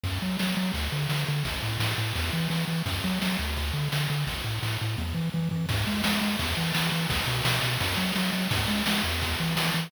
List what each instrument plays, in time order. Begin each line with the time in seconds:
0.04 synth bass 1 F#2, kick, crash
0.22 synth bass 1 F#3
0.39 synth bass 1 F#3, snare
0.57 synth bass 1 F#3
0.74 synth bass 1 D2, kick, ride
0.92 synth bass 1 D3
1.09 synth bass 1 D3, snare
1.28 synth bass 1 D3
1.45 synth bass 1 A1, kick, ride
1.63 synth bass 1 A2
1.79 synth bass 1 A2, snare
1.98 synth bass 1 A2
2.15 synth bass 1 E2, kick, ride
2.33 synth bass 1 E3
2.50 synth bass 1 E3, snare
2.67 synth bass 1 E3
2.86 synth bass 1 F#2, kick, ride
3.04 synth bass 1 F#3
3.22 synth bass 1 F#3, snare
3.39 synth bass 1 D2
3.56 kick, ride
3.73 synth bass 1 D3
3.92 synth bass 1 D3, snare
4.10 synth bass 1 D3
4.27 synth bass 1 A1, kick, ride
4.44 synth bass 1 A2
4.63 synth bass 1 A2, snare
4.81 synth bass 1 A2
4.98 synth bass 1 E2, kick, high tom
5.14 synth bass 1 E3, floor tom
5.33 synth bass 1 E3, high tom
5.51 synth bass 1 E3, floor tom
5.69 synth bass 1 G#2, kick, crash
5.87 synth bass 1 G#3
6.04 synth bass 1 G#3, snare
6.21 synth bass 1 G#3
6.39 synth bass 1 E2, kick, ride
6.57 synth bass 1 E3
6.75 synth bass 1 E3, snare
6.92 synth bass 1 E3
7.10 synth bass 1 B1, kick, ride
7.27 synth bass 1 B2
7.45 synth bass 1 B2, snare
7.63 synth bass 1 B2
7.80 synth bass 1 F#2, kick, ride
7.97 synth bass 1 F#3
8.15 synth bass 1 F#3, snare
8.33 synth bass 1 F#3
8.51 synth bass 1 G#2, kick, ride
8.68 synth bass 1 G#3
8.86 synth bass 1 G#3, snare
9.04 synth bass 1 E2
9.21 kick, ride
9.40 synth bass 1 E3
9.56 synth bass 1 E3, snare
9.74 synth bass 1 E3